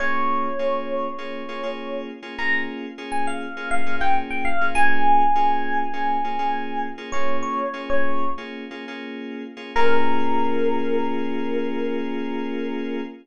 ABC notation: X:1
M:4/4
L:1/16
Q:1/4=101
K:Bbdor
V:1 name="Electric Piano 1"
d16 | b2 z3 a f3 f2 g z g f2 | a16 | "^rit." d2 d3 d3 z8 |
B16 |]
V:2 name="Electric Piano 2"
[B,DFA]4 [B,DFA]4 [B,DFA]2 [B,DFA] [B,DFA]4 [B,DFA] | [B,DFA]4 [B,DFA]4 [B,DFA]2 [B,DFA] [B,DFA]4 [B,DFA] | [B,DFA]4 [B,DFA]4 [B,DFA]2 [B,DFA] [B,DFA]4 [B,DFA] | "^rit." [B,DFA]4 [B,DFA]4 [B,DFA]2 [B,DFA] [B,DFA]4 [B,DFA] |
[B,DFA]16 |]